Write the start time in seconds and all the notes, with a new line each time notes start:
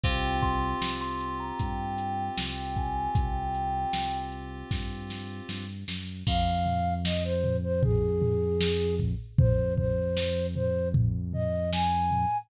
0.04 C2 C4 F4 G4 G5, kick, closed hi-hat
0.43 C6, kick, closed hi-hat
0.81 C2, snare
1.01 C6
1.20 closed hi-hat
1.40 A#5
1.59 G2 G5, kick, closed hi-hat
1.98 closed hi-hat
2.37 C2 G5, snare
2.76 G#5, kick, closed hi-hat
3.15 C2 G5, kick, closed hi-hat
3.54 closed hi-hat
3.93 C2, snare
4.32 closed hi-hat
4.71 G2, kick, snare
5.10 snare
5.49 G2, snare
5.88 F#2, snare
6.27 F2 F5, kick, crash
6.66 floor tom
7.05 D#5, snare
7.24 C5
7.44 floor tom
7.63 C5
7.83 G#4, kick, floor tom
8.22 floor tom
8.61 snare
9.00 kick, floor tom
9.38 F2 C5, kick, floor tom
9.77 C5, kick, floor tom
10.17 snare
10.56 C5, floor tom
10.94 kick, floor tom
11.33 D#5, floor tom
11.72 G#5, snare
12.11 floor tom